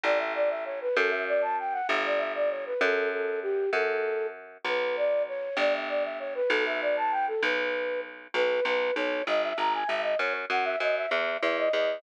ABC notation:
X:1
M:6/8
L:1/16
Q:3/8=65
K:Bm
V:1 name="Flute"
d e d e c B | A e d a g f e d e d c B | A2 A2 G2 A4 z2 | B2 d2 c2 d e d e c B |
A e d a g A B4 z2 | [K:B] B2 B2 c2 d e a g e d | c z f e d e e2 e d d2 |]
V:2 name="Harpsichord" clef=bass
A,,,6 | F,,6 G,,,6 | F,,6 F,,6 | B,,,6 G,,,6 |
B,,,6 B,,,6 | [K:B] B,,,2 B,,,2 B,,,2 G,,,2 G,,,2 G,,,2 | F,,2 F,,2 F,,2 E,,2 E,,2 E,,2 |]